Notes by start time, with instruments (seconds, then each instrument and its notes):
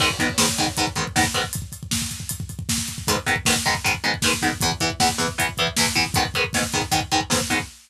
0.00 overdriven guitar G#2 D#3 B3, kick, crash
0.10 kick
0.19 overdriven guitar G#2 D#3 B3, kick, closed hi-hat
0.29 kick
0.38 overdriven guitar G#2 D#3 B3, kick, snare
0.49 kick
0.58 overdriven guitar G#2 D#3 B3, kick, closed hi-hat
0.68 kick
0.77 overdriven guitar G#2 D#3 B3, kick, closed hi-hat
0.87 kick
0.96 overdriven guitar G#2 D#3 B3, kick, closed hi-hat
1.07 kick
1.16 overdriven guitar G#2 D#3 B3, kick, snare
1.24 kick
1.34 overdriven guitar G#2 D#3 B3, kick, closed hi-hat
1.44 kick
1.53 kick, closed hi-hat
1.62 kick
1.72 kick, closed hi-hat
1.83 kick
1.91 kick, snare
2.02 kick
2.11 kick, closed hi-hat
2.20 kick
2.29 kick, closed hi-hat
2.40 kick
2.49 kick, closed hi-hat
2.59 kick
2.69 kick, snare
2.78 kick
2.88 kick, closed hi-hat
2.98 kick
3.07 overdriven guitar G#2 D#3 B3, kick, closed hi-hat
3.16 kick
3.26 overdriven guitar G#2 D#3 B3, kick, closed hi-hat
3.36 kick
3.45 overdriven guitar G#2 D#3 B3, kick, snare
3.56 kick
3.65 overdriven guitar G#2 D#3 B3, kick, closed hi-hat
3.75 kick
3.84 overdriven guitar G#2 D#3 B3, kick, closed hi-hat
3.94 kick
4.04 overdriven guitar G#2 D#3 B3, closed hi-hat
4.14 kick
4.22 overdriven guitar G#2 D#3 B3, kick, snare
4.33 kick
4.42 overdriven guitar G#2 D#3 B3, kick, closed hi-hat
4.53 kick
4.61 overdriven guitar E2 E3 B3, kick, closed hi-hat
4.72 kick
4.80 overdriven guitar E2 E3 B3, kick, closed hi-hat
4.90 kick
5.00 overdriven guitar E2 E3 B3, kick, snare
5.09 kick
5.18 overdriven guitar E2 E3 B3, kick, closed hi-hat
5.28 kick
5.38 overdriven guitar E2 E3 B3, kick, closed hi-hat
5.49 kick
5.57 overdriven guitar E2 E3 B3, kick, closed hi-hat
5.67 kick
5.77 overdriven guitar E2 E3 B3, kick, snare
5.87 kick
5.95 overdriven guitar E2 E3 B3, kick, closed hi-hat
6.06 kick
6.14 overdriven guitar G#2 D#3 B3, kick, closed hi-hat
6.25 kick
6.34 overdriven guitar G#2 D#3 B3, kick, closed hi-hat
6.44 kick
6.53 overdriven guitar G#2 D#3 B3, kick, snare
6.63 kick
6.73 overdriven guitar G#2 D#3 B3, kick, closed hi-hat
6.82 kick
6.92 overdriven guitar G#2 D#3 B3, kick, closed hi-hat
7.01 kick
7.12 overdriven guitar G#2 D#3 B3, kick, closed hi-hat
7.21 kick
7.30 overdriven guitar G#2 D#3 B3, kick, snare
7.41 kick
7.50 overdriven guitar G#2 D#3 B3, kick, closed hi-hat
7.60 kick